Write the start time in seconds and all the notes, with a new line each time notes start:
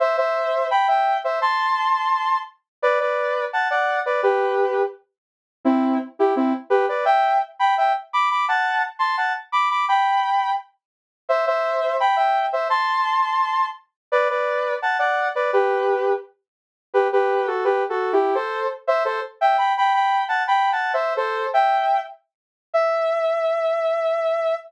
0.00 C5 E5
0.17 C5 E5
0.71 G5 B5
0.88 E5 G5
1.24 C5 E5
1.42 A5 C6
2.82 B4 D5
3.00 B4 D5
3.53 F#5 A5
3.71 D5 F#5
4.06 B4 D5
4.23 G4 B4
5.65 C4 E4
6.19 E4 G4
6.36 C4 E4
6.70 G4 B4
6.89 B4 D5
7.05 E5 G5
7.59 G5 B5
7.77 E5 G5
8.13 B5 D6
8.31 B5 D6
8.48 F#5 A5
8.99 A5 C6
9.17 F#5 A5
9.52 B5 D6
9.70 B5 D6
9.88 G5 B5
11.29 C5 E5
11.47 C5 E5
12.00 G5 B5
12.16 E5 G5
12.53 C5 E5
12.70 A5 C6
14.12 B4 D5
14.30 B4 D5
14.82 F#5 A5
14.99 D5 F#5
15.35 B4 D5
15.53 G4 B4
16.94 G4 B4
17.12 G4 B4
17.47 F#4 A4
17.64 G4 B4
17.89 F#4 A4
18.13 E4 G4
18.35 A4 C5
18.87 C5 E5
19.05 A4 C5
19.41 E5 G5
19.58 G5 B5
19.77 G5 B5
19.93 G5 B5
20.28 F#5 A5
20.47 G5 B5
20.72 F#5 A5
20.93 C5 E5
21.17 A4 C5
21.54 E5 G5
22.74 E5